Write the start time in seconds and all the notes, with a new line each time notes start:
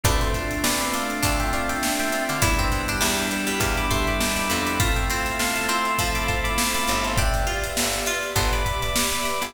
0.04 D2 A3 C4 D4 F4 B4 D5, kick, closed hi-hat
0.21 A4 C5, closed hi-hat
0.34 A3 C4 D4 F4, kick, closed hi-hat
0.51 closed hi-hat
0.64 D2 B4 D5, snare
0.80 B4 D5, closed hi-hat
0.93 A3 C4 D4 F4 D5 F5, closed hi-hat
1.10 closed hi-hat
1.23 D2 D4, kick, closed hi-hat
1.40 E5 G5, closed hi-hat
1.53 A3 C4 D4 F4 D5 F5, closed hi-hat
1.69 E5 G5, snare, closed hi-hat
1.83 snare
1.99 E5 G5, closed hi-hat
2.12 A3 C4 D4 F4, closed hi-hat
2.29 D3 D5 F5, snare, closed hi-hat
2.42 E2 G3 B3 D4 E4 B4 D5, kick, closed hi-hat
2.59 C4, kick, closed hi-hat
2.72 G3 B3 D4 E4, kick, snare, closed hi-hat
2.88 D4, closed hi-hat
3.01 E2 G3, snare
3.18 closed hi-hat
3.31 G3 B3 D4 E4, closed hi-hat
3.47 G3, closed hi-hat
3.60 E2 D5 F5, kick, closed hi-hat
3.77 B5 D6, closed hi-hat
3.90 G3 A3 B3 D4 E4 A5 C6, kick, closed hi-hat
4.07 B5 D6, closed hi-hat
4.20 D#2, snare
4.36 B5 D6, closed hi-hat
4.49 F2 G3 B3 D4 E4 B5 D6, closed hi-hat
4.66 B5 D6, closed hi-hat
4.80 A3 C4 E4 F4 A4 C5 E5 F5 A5, kick, closed hi-hat
4.96 E5 G5, snare, closed hi-hat
5.10 A3 C4 E4 F4, closed hi-hat
5.26 closed hi-hat
5.39 C3 F5 A5, snare
5.56 F5 A5, closed hi-hat
5.68 A3 C4 E4 F4 A5 C6, closed hi-hat
5.85 closed hi-hat
5.99 F3, kick, closed hi-hat
6.15 B5 D6, closed hi-hat
6.28 A3 C4 E4 F4 A5 C6, kick, closed hi-hat
6.44 B5 D6, closed hi-hat
6.58 snare
6.75 B5 D6, closed hi-hat
6.87 G1 A3 C4 E4 F4, closed hi-hat
7.04 A5 C6, closed hi-hat
7.17 D4 G4 B4 D5 E5 G5, kick, closed hi-hat
7.34 closed hi-hat
7.47 F4, closed hi-hat
7.64 closed hi-hat
7.77 G1, snare
7.93 closed hi-hat
8.06 F4, closed hi-hat
8.23 snare, closed hi-hat
8.36 G1 B3 A5 C6, kick, closed hi-hat
8.53 B5 D6, snare, closed hi-hat
8.65 B5 D6, kick, closed hi-hat
8.82 B5 D6, closed hi-hat
8.96 snare
9.12 B5 D6, closed hi-hat
9.25 B5 D6, snare, closed hi-hat
9.41 G1 B5 D6, snare, closed hi-hat